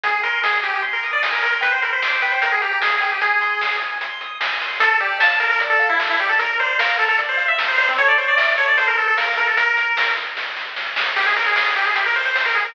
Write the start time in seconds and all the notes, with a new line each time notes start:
0.03 G#1 G#4 G#5, kick, closed hi-hat
0.23 G#1 A#4 C6, kick, closed hi-hat
0.43 G#1 G#4 D#6, snare
0.63 G#1 G4 G#5, closed hi-hat
0.73 G4
0.82 G#1 C6, kick
0.93 A#4
1.03 G#1 D#6, closed hi-hat
1.13 D5
1.23 G#1 G#5, snare
1.32 A#4
1.42 G#1 A#4 C6, closed hi-hat
1.52 A#4
1.61 G1 B4 G5, kick, closed hi-hat
1.72 C5
1.82 G1 A#4 B5, kick, closed hi-hat
1.93 C5
2.02 G1 D6, snare
2.21 G1 B4 G5, kick, closed hi-hat
2.32 C5
2.42 D#2 A#4, kick, closed hi-hat
2.52 G#4
2.61 D#2 G4 A#5, closed hi-hat
2.71 G4
2.82 D#2 G#4 D#6, snare
2.92 G#4
3.00 D#2 G#4 G5, closed hi-hat
3.12 G4
3.21 G#1 G#4 G#5, kick, closed hi-hat
3.41 G#1 C6, kick, closed hi-hat
3.60 G#1 D#6, snare
3.79 G#1 G#5, kick, closed hi-hat
4.01 G#1 C6, kick, closed hi-hat
4.21 G#1 D#6, closed hi-hat
4.40 G#1 G#5, snare
4.61 G#1 C6, open hi-hat
4.79 D2 A4, kick, closed hi-hat
5.00 D2 G4 D5, closed hi-hat
5.20 D2 F5 A5, snare
5.40 D2 A4 A#4, closed hi-hat
5.50 A#4
5.60 D2 D5, kick, closed hi-hat
5.70 A4
5.79 D2 F5, closed hi-hat
5.89 E4
5.99 D2 A4, snare
6.10 E4
6.19 D2 G4 D5, closed hi-hat
6.29 A4
6.39 A#1 A#4, kick, closed hi-hat
6.59 A#1 C5 D5, kick, closed hi-hat
6.79 A#1 A#4 F5, snare
6.99 A#1 A4 A#4, kick, closed hi-hat
7.09 A4
7.18 A#1 D5, kick, closed hi-hat
7.29 C5
7.37 A#1 F5, closed hi-hat
7.48 E5
7.58 A#1 A#4, snare
7.68 C5
7.78 A#1 C5 D5, open hi-hat
7.88 C4
7.98 A1 A4 C#5, kick, closed hi-hat
8.08 D5
8.18 A1 C5 C#5, kick, closed hi-hat
8.28 D5
8.37 A1 E5, snare
8.58 A1 A4 C#5, kick, closed hi-hat
8.68 D5
8.77 F2 A4 C5, kick, closed hi-hat
8.88 A#4
8.97 F2 A4 C5, closed hi-hat
9.08 A4
9.17 F2 A#4 F5, snare
9.27 A#4
9.37 F2 A4 A#4, closed hi-hat
9.47 A4
9.57 A#1 A#4, kick, closed hi-hat
9.77 A#1, kick, closed hi-hat
9.97 A#1, snare
10.17 A#1, kick, closed hi-hat
10.37 A#1, kick, snare
10.57 A#1, snare
10.76 A#1, snare
10.96 A#1, snare
11.16 G4, kick, crash
11.26 G#4, closed hi-hat
11.36 A#4, kick, closed hi-hat
11.46 G#4, closed hi-hat
11.56 snare
11.66 closed hi-hat
11.76 G4, closed hi-hat
11.86 G#4, closed hi-hat
11.96 G4, kick, closed hi-hat
12.06 A#4, closed hi-hat
12.16 C5, closed hi-hat
12.25 C5, closed hi-hat
12.35 C5, snare
12.45 A#4, closed hi-hat
12.55 G#4, closed hi-hat
12.65 A#4, closed hi-hat